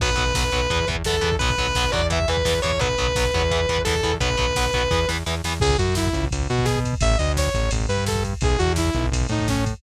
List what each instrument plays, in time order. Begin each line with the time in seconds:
0.00 synth bass 1 B1, overdriven guitar F#3 B3, distortion guitar B4, kick, crash
0.09 kick
0.16 synth bass 1 B1, overdriven guitar F#3 B3, kick, closed hi-hat
0.27 kick
0.34 synth bass 1 B1, overdriven guitar F#3 B3, kick, snare
0.43 kick
0.51 synth bass 1 B1, overdriven guitar F#3 B3, kick, closed hi-hat
0.61 kick
0.70 synth bass 1 E2, overdriven guitar E3 B3, kick, closed hi-hat
0.80 kick
0.87 synth bass 1 E2, overdriven guitar E3 B3, kick, closed hi-hat
0.95 kick
1.04 synth bass 1 E2, overdriven guitar E3 B3, distortion guitar A4, kick, snare
1.13 kick
1.21 synth bass 1 E2, overdriven guitar E3 B3, kick, closed hi-hat
1.32 kick
1.39 synth bass 1 B1, overdriven guitar F#3 B3, distortion guitar B4, kick, closed hi-hat
1.50 kick
1.58 synth bass 1 B1, overdriven guitar F#3 B3, kick, closed hi-hat
1.67 kick
1.75 synth bass 1 B1, overdriven guitar F#3 B3, kick, snare
1.84 kick
1.92 synth bass 1 E2, overdriven guitar F#3 B3, distortion guitar D5, kick, closed hi-hat
2.02 kick
2.10 overdriven guitar E3 B3, distortion guitar E5, kick, closed hi-hat
2.20 kick
2.28 synth bass 1 E2, overdriven guitar E3 B3, distortion guitar B4, kick, closed hi-hat
2.37 kick
2.45 synth bass 1 E2, overdriven guitar E3 B3, kick, snare
2.54 kick
2.62 synth bass 1 E2, overdriven guitar E3 B3, distortion guitar C#5, kick, open hi-hat
2.72 kick
2.79 synth bass 1 B1, overdriven guitar F#3 B3, distortion guitar B4, kick, closed hi-hat
2.89 kick
2.98 synth bass 1 B1, overdriven guitar F#3 B3, kick, closed hi-hat
3.08 kick
3.15 synth bass 1 B1, overdriven guitar F#3 B3, kick, snare
3.25 kick
3.32 synth bass 1 E2, overdriven guitar F#3 B3, kick, closed hi-hat
3.42 kick
3.51 overdriven guitar E3 B3, kick, closed hi-hat
3.59 kick
3.68 synth bass 1 E2, overdriven guitar E3 B3, kick, closed hi-hat
3.78 kick
3.85 synth bass 1 E2, overdriven guitar E3 B3, distortion guitar A4, kick, snare
3.95 kick
4.03 synth bass 1 E2, overdriven guitar E3 B3, kick, closed hi-hat
4.13 kick
4.20 synth bass 1 B1, overdriven guitar F#3 B3, distortion guitar B4, kick, closed hi-hat
4.30 kick
4.37 synth bass 1 B1, overdriven guitar F#3 B3, kick, closed hi-hat
4.48 kick
4.55 synth bass 1 B1, overdriven guitar F#3 B3, kick, snare
4.66 kick
4.73 synth bass 1 B1, overdriven guitar F#3 B3, kick, closed hi-hat
4.83 kick
4.91 synth bass 1 E2, overdriven guitar E3 B3, kick, snare
5.08 synth bass 1 E2, overdriven guitar E3 B3, snare
5.26 synth bass 1 E2, overdriven guitar E3 B3, snare
5.44 synth bass 1 E2, overdriven guitar E3 B3, snare
5.60 synth bass 1 C#2, lead 2 (sawtooth) G#4, kick, crash
5.70 kick
5.78 synth bass 1 F#2, lead 2 (sawtooth) F#4, kick, ride
5.88 kick
5.95 lead 2 (sawtooth) E4, kick, snare
6.06 kick
6.13 synth bass 1 C#2, kick, ride
6.24 kick
6.31 synth bass 1 C#2, kick, ride
6.41 kick
6.49 synth bass 1 B2, lead 2 (sawtooth) F#4, kick
6.59 kick
6.65 lead 2 (sawtooth) G#4, kick, snare
6.76 kick
6.84 kick, ride
6.93 kick
7.01 synth bass 1 A1, lead 2 (sawtooth) E5, kick, ride
7.11 kick
7.18 synth bass 1 D2, lead 2 (sawtooth) D#5, kick, ride
7.27 kick
7.37 lead 2 (sawtooth) C#5, kick, snare
7.47 kick
7.54 synth bass 1 A1, kick, ride
7.63 kick
7.71 synth bass 1 A1, kick, ride
7.80 kick
7.88 synth bass 1 G2, lead 2 (sawtooth) B4, kick, ride
7.98 kick
8.06 lead 2 (sawtooth) A4, kick, snare
8.15 kick
8.24 kick, ride
8.33 kick
8.41 synth bass 1 B1, lead 2 (sawtooth) G#4, kick, ride
8.50 kick
8.58 synth bass 1 E2, lead 2 (sawtooth) F#4, kick, ride
8.68 kick
8.76 lead 2 (sawtooth) E4, kick, snare
8.85 kick
8.93 synth bass 1 B1, kick, ride
9.03 kick
9.12 synth bass 1 B1, kick, ride
9.21 kick
9.29 synth bass 1 A2, lead 2 (sawtooth) D#4, kick, ride
9.39 kick
9.48 lead 2 (sawtooth) C#4, kick, snare
9.55 kick
9.66 kick, ride
9.73 kick